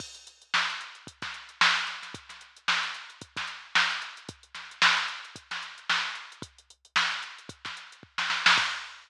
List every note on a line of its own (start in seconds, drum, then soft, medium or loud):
0.00 kick loud
0.00 crash loud
0.15 closed hi-hat medium
0.27 closed hi-hat loud
0.42 closed hi-hat medium
0.54 snare loud
0.70 closed hi-hat medium
0.81 closed hi-hat medium
0.95 closed hi-hat medium
1.07 kick loud
1.07 closed hi-hat loud
1.22 kick loud
1.22 snare medium
1.22 closed hi-hat medium
1.34 closed hi-hat medium
1.49 closed hi-hat medium
1.61 snare loud
1.77 snare soft
1.77 closed hi-hat medium
1.87 snare soft
1.87 closed hi-hat medium
2.03 snare soft
2.03 closed hi-hat medium
2.14 kick loud
2.14 closed hi-hat loud
2.29 snare soft
2.29 closed hi-hat medium
2.41 closed hi-hat medium
2.56 closed hi-hat medium
2.68 snare loud
2.83 snare soft
2.83 closed hi-hat medium
2.95 closed hi-hat medium
3.10 closed hi-hat medium
3.21 kick loud
3.21 closed hi-hat loud
3.36 kick loud
3.36 snare medium
3.36 closed hi-hat medium
3.47 closed hi-hat medium
3.75 snare loud
3.75 closed hi-hat medium
3.91 closed hi-hat medium
4.02 closed hi-hat medium
4.17 closed hi-hat medium
4.29 kick loud
4.29 closed hi-hat loud
4.43 closed hi-hat medium
4.55 snare medium
4.55 closed hi-hat medium
4.71 closed hi-hat medium
4.82 snare loud
4.97 closed hi-hat medium
5.08 closed hi-hat medium
5.25 closed hi-hat medium
5.36 kick medium
5.36 closed hi-hat loud
5.51 snare medium
5.51 closed hi-hat medium
5.62 closed hi-hat medium
5.78 closed hi-hat medium
5.90 snare loud
6.15 closed hi-hat medium
6.32 closed hi-hat medium
6.42 kick loud
6.42 closed hi-hat loud
6.58 closed hi-hat medium
6.70 closed hi-hat medium
6.85 closed hi-hat medium
6.96 snare loud
7.11 closed hi-hat medium
7.23 closed hi-hat medium
7.38 closed hi-hat medium
7.49 kick loud
7.49 closed hi-hat loud
7.65 kick medium
7.65 snare medium
7.65 closed hi-hat medium
7.77 closed hi-hat medium
7.92 closed hi-hat medium
8.03 kick medium
8.18 snare medium
8.30 snare medium
8.46 snare loud
8.57 kick loud
8.57 crash loud